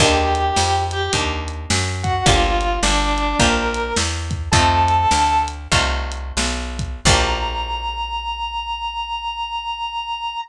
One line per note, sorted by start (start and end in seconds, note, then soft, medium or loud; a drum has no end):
0.00 0.51 D#2 medium
0.00 1.05 A#3 loud
0.00 1.05 D4 loud
0.00 1.05 D#4 loud
0.00 1.05 G4 loud
0.00 0.79 G4 loud
0.00 0.79 G5 loud
0.00 kick medium
0.00 crash loud
0.35 closed hi-hat medium
0.56 1.09 F2 medium
0.56 snare loud
0.91 1.11 G4 medium
0.91 1.11 G5 medium
0.91 closed hi-hat medium
1.13 1.66 D#2 medium
1.13 2.17 A#3 medium
1.13 2.17 D4 loud
1.13 2.17 D#4 medium
1.13 2.17 G4 medium
1.13 kick medium
1.13 closed hi-hat loud
1.48 closed hi-hat medium
1.70 2.22 F#2 medium
1.70 snare loud
2.03 2.24 F#4 medium
2.03 2.24 F#5 medium
2.03 kick medium
2.03 closed hi-hat medium
2.26 2.79 G1 medium
2.26 3.30 A#3 loud
2.26 3.30 D4 loud
2.26 3.30 F4 medium
2.26 2.75 F4 medium
2.26 3.30 G4 loud
2.26 2.75 F5 loud
2.26 kick loud
2.26 closed hi-hat loud
2.61 closed hi-hat medium
2.83 3.35 G1 medium
2.83 3.35 D4 medium
2.83 3.35 D5 loud
2.83 snare loud
3.18 closed hi-hat medium
3.39 3.93 A#1 medium
3.39 4.44 A#3 medium
3.39 4.44 D4 medium
3.39 4.44 F4 medium
3.39 4.44 G4 medium
3.39 3.92 A#4 medium
3.39 3.92 A#5 loud
3.39 kick medium
3.39 closed hi-hat loud
3.74 closed hi-hat medium
3.96 4.49 E2 medium
3.96 snare loud
4.31 kick medium
4.31 closed hi-hat medium
4.52 5.06 F2 loud
4.52 5.63 A3 loud
4.52 5.63 C4 loud
4.52 5.63 D#4 loud
4.52 5.63 F4 loud
4.52 5.37 A4 medium
4.52 5.37 A5 loud
4.52 kick loud
4.52 closed hi-hat loud
4.88 closed hi-hat medium
5.11 5.68 D2 medium
5.11 snare loud
5.48 closed hi-hat medium
5.72 6.32 C2 medium
5.72 6.95 A3 medium
5.72 6.95 C4 medium
5.72 6.95 D#4 medium
5.72 6.95 F4 medium
5.72 kick medium
5.72 closed hi-hat loud
6.12 closed hi-hat medium
6.37 7.01 B1 medium
6.37 snare loud
6.79 kick medium
6.79 closed hi-hat medium
7.05 10.36 A#1 loud
7.05 10.37 A#3 medium
7.05 10.37 D4 loud
7.05 10.37 F4 loud
7.05 10.37 G4 loud
7.05 10.37 A#5 loud
7.05 kick loud
7.05 crash loud